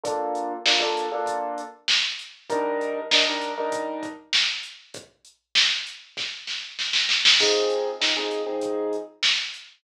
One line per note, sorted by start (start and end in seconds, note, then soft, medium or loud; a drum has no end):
0.04 0.53 A#3 medium
0.04 0.53 D4 medium
0.04 0.53 F4 medium
0.04 0.53 A4 medium
0.04 kick loud
0.04 closed hi-hat loud
0.35 closed hi-hat medium
0.66 0.78 A#3 medium
0.66 0.78 D4 medium
0.66 0.78 F4 medium
0.66 0.78 A4 medium
0.66 snare loud
0.80 1.04 A#3 medium
0.80 1.04 D4 medium
0.80 1.04 F4 medium
0.80 1.04 A4 medium
0.97 closed hi-hat medium
1.12 1.61 A#3 medium
1.12 1.61 D4 medium
1.12 1.61 F4 medium
1.12 1.61 A4 medium
1.26 kick medium
1.26 closed hi-hat loud
1.58 closed hi-hat medium
1.88 snare loud
2.19 closed hi-hat medium
2.50 2.99 G3 medium
2.50 2.99 D4 medium
2.50 2.99 D#4 medium
2.50 2.99 A#4 medium
2.50 kick loud
2.50 closed hi-hat loud
2.81 closed hi-hat medium
3.11 3.23 G3 medium
3.11 3.23 D4 medium
3.11 3.23 D#4 medium
3.11 3.23 A#4 medium
3.11 snare loud
3.27 3.52 G3 medium
3.27 3.52 D4 medium
3.27 3.52 D#4 medium
3.27 3.52 A#4 medium
3.41 closed hi-hat medium
3.58 4.07 G3 medium
3.58 4.07 D4 medium
3.58 4.07 D#4 medium
3.58 4.07 A#4 medium
3.72 kick loud
3.72 closed hi-hat loud
4.03 kick loud
4.03 closed hi-hat medium
4.33 snare loud
4.63 closed hi-hat medium
4.94 kick loud
4.94 closed hi-hat loud
5.25 closed hi-hat medium
5.55 snare loud
5.87 closed hi-hat medium
6.17 kick loud
6.17 snare medium
6.47 snare medium
6.79 snare medium
6.93 snare loud
7.09 snare loud
7.25 snare loud
7.40 7.89 F3 medium
7.40 7.89 C4 medium
7.40 7.89 D#4 medium
7.40 7.89 G#4 medium
7.40 kick loud
7.40 crash loud
7.70 closed hi-hat medium
8.01 8.13 F3 medium
8.01 8.13 C4 medium
8.01 8.13 D#4 medium
8.01 8.13 G#4 medium
8.01 snare loud
8.17 8.41 F3 medium
8.17 8.41 C4 medium
8.17 8.41 D#4 medium
8.17 8.41 G#4 medium
8.31 closed hi-hat medium
8.46 8.95 F3 medium
8.46 8.95 C4 medium
8.46 8.95 D#4 medium
8.46 8.95 G#4 medium
8.61 kick medium
8.61 closed hi-hat loud
8.93 closed hi-hat medium
9.23 snare loud
9.54 closed hi-hat medium